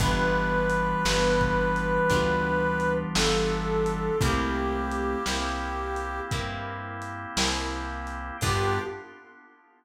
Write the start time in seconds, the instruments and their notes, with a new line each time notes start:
0.00 electric bass (finger) G1, ocarina E3 G3, acoustic guitar (steel) B3 D4 F4 G4, drawbar organ B3 D4 F4 G4, brass section B4, kick, closed hi-hat
0.70 closed hi-hat
1.05 electric bass (finger) G1, acoustic guitar (steel) B3 D4 F4 G4, snare
1.41 kick
1.76 closed hi-hat
2.10 electric bass (finger) D2, acoustic guitar (steel) B3 D4 F4 G4, kick, closed hi-hat
2.80 closed hi-hat
3.15 electric bass (finger) G1, acoustic guitar (steel) B3 D4 F4 G4, brass section A4, snare
3.86 closed hi-hat
4.20 electric bass (finger) C2, ocarina A3 C4, drawbar organ A#3 C4 E4 G4, acoustic guitar (steel) A#3 C4 E4 G4, brass section G4, kick, closed hi-hat
4.91 closed hi-hat
5.26 electric bass (finger) C2, acoustic guitar (steel) A#3 C4 E4 G4, snare
5.96 closed hi-hat
6.31 electric bass (finger) G2, acoustic guitar (steel) A#3 C4 E4 G4, kick, closed hi-hat
7.02 closed hi-hat
7.37 electric bass (finger) C2, acoustic guitar (steel) A#3 C4 E4 G4, snare
8.07 closed hi-hat
8.41 electric bass (finger) G2, ocarina G3, acoustic guitar (steel) B3 D4 F4 G4, drawbar organ B3 D4 F4 G4, brass section G4, kick, crash